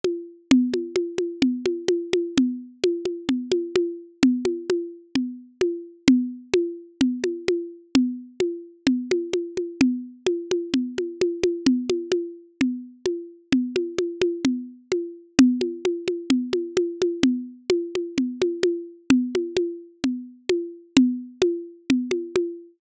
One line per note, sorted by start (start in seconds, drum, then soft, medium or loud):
0.04 high conga medium
0.51 low conga loud
0.74 high conga medium
0.96 high conga medium
1.18 high conga medium
1.42 low conga loud
1.66 high conga medium
1.88 high conga loud
2.13 high conga medium
2.37 low conga loud
2.84 high conga loud
3.05 high conga medium
3.29 low conga medium
3.52 high conga medium
3.76 high conga loud
4.23 low conga loud
4.45 high conga medium
4.70 high conga medium
5.15 low conga medium
5.61 high conga medium
6.08 low conga loud
6.54 high conga loud
7.01 low conga loud
7.24 high conga medium
7.48 high conga medium
7.95 low conga loud
8.40 high conga medium
8.87 low conga loud
9.11 high conga medium
9.33 high conga medium
9.57 high conga medium
9.81 low conga loud
10.26 high conga medium
10.51 high conga medium
10.74 low conga medium
10.98 high conga medium
11.21 high conga medium
11.44 high conga loud
11.66 low conga loud
11.90 high conga medium
12.12 high conga medium
12.61 low conga loud
13.06 high conga medium
13.52 low conga loud
13.76 high conga medium
13.98 high conga medium
14.22 high conga medium
14.45 low conga loud
14.92 high conga medium
15.39 low conga loud
15.61 high conga medium
15.85 high conga medium
16.08 high conga medium
16.30 low conga loud
16.53 high conga medium
16.77 high conga loud
17.02 high conga medium
17.23 low conga loud
17.70 high conga loud
17.95 high conga medium
18.18 low conga medium
18.42 high conga medium
18.63 high conga loud
19.10 low conga loud
19.35 high conga medium
19.57 high conga medium
20.04 low conga medium
20.49 high conga medium
20.97 low conga loud
21.42 high conga loud
21.90 low conga loud
22.11 high conga medium
22.36 high conga medium